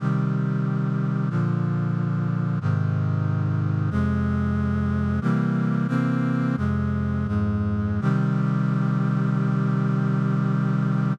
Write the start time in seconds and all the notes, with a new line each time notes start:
0.00 C3 D#3 G3
1.30 A#2 D3 F3
2.61 G#2 C3 D#3
3.90 F2 C3 G#3
5.21 C3 E3 G3 A#3
5.88 C3 E3 A#3 C4
6.57 F2 C3 G#3
7.27 F2 G#2 G#3
8.01 C3 D#3 G3